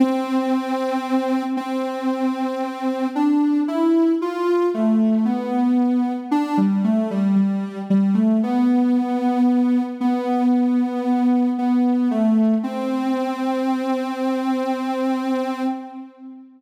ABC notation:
X:1
M:4/4
L:1/16
Q:1/4=57
K:C
V:1 name="Ocarina"
C6 C6 D2 E2 | F2 A,2 B,4 D G, A, G, G,2 G, A, | B,6 B,6 B,2 A,2 | C14 z2 |]